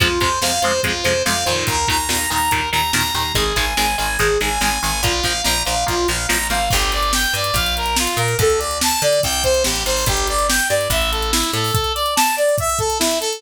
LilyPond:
<<
  \new Staff \with { instrumentName = "Lead 2 (sawtooth)" } { \time 4/4 \key f \dorian \tempo 4 = 143 f'8 c''8 f''8 c''8 f'8 c''8 f''8 c''8 | bes'8 bes''8 bes''8 bes''8 bes'8 bes''8 bes''8 bes''8 | aes'8 aes''8 aes''8 aes''8 aes'8 aes''8 aes''8 aes''8 | f'8 f''8 bes''8 f''8 f'8 f''8 bes''8 f''8 |
\key g \dorian g'8 d''8 g''8 d''8 f''8 bes'8 f'8 bes'8 | a'8 d''8 a''8 d''8 g''8 c''8 g'8 c''8 | g'8 d''8 g''8 d''8 e''8 a'8 e'8 a'8 | a'8 d''8 a''8 d''8 e''8 a'8 e'8 a'8 | }
  \new Staff \with { instrumentName = "Overdriven Guitar" } { \time 4/4 \key f \dorian <c f aes>8 <c f aes>8 <c f aes>8 <c f aes>8 <c f aes>8 <c f aes>8 <c f aes>8 <bes, ees>8~ | <bes, ees>8 <bes, ees>8 <bes, ees>8 <bes, ees>8 <bes, ees>8 <bes, ees>8 <bes, ees>8 <bes, ees>8 | <ees aes>8 <ees aes>8 <ees aes>8 <ees aes>8 <ees aes>8 <ees aes>8 <ees aes>8 <ees aes>8 | <f bes>8 <f bes>8 <f bes>8 <f bes>8 <f bes>8 <f bes>8 <f bes>8 <f bes>8 |
\key g \dorian r1 | r1 | r1 | r1 | }
  \new Staff \with { instrumentName = "Electric Bass (finger)" } { \clef bass \time 4/4 \key f \dorian f,8 f,8 f,8 f,8 f,8 f,8 f,8 f,8 | ees,8 ees,8 ees,8 ees,8 ees,8 ees,8 ees,8 ees,8 | aes,,8 aes,,8 aes,,8 aes,,8 aes,,8 aes,,8 aes,,8 aes,,8 | bes,,8 bes,,8 bes,,8 bes,,8 bes,,8 bes,,8 a,,8 aes,,8 |
\key g \dorian g,,4. g,8 bes,,4. bes,8 | d,4. d8 c,4 a,,8 aes,,8 | g,,4. g,8 a,,4. a,8 | r1 | }
  \new DrumStaff \with { instrumentName = "Drums" } \drummode { \time 4/4 <hh bd>8 <hh bd>8 sn8 hh8 <hh bd>8 hh8 sn8 hh8 | <hh bd>8 <hh bd>8 sn8 hh8 <hh bd>8 hh8 sn8 hh8 | <hh bd>8 <hh bd>8 sn8 hh8 <hh bd>8 hh8 sn8 hh8 | <hh bd>8 <hh bd>8 sn8 hh8 <hh bd>8 hh8 sn8 hh8 |
<cymc bd>16 hh16 hh16 hh16 sn16 hh16 hh16 hh16 <hh bd>16 hh16 hh16 hh16 sn16 hh16 hh16 hh16 | <hh bd>16 hh16 hh16 hh16 sn16 hh16 hh16 hh16 <hh bd>16 hh16 <hh bd>16 hh16 sn16 hh16 hh16 hho16 | <hh bd>16 hh16 hh16 hh16 sn16 hh16 hh16 hh16 <hh bd>16 hh16 hh16 hh16 sn16 hh16 hh16 hho16 | <hh bd>16 hh16 hh16 hh16 sn16 hh16 hh16 hh16 <hh bd>16 hh16 <hh bd>16 hh16 sn16 hh16 hh16 hh16 | }
>>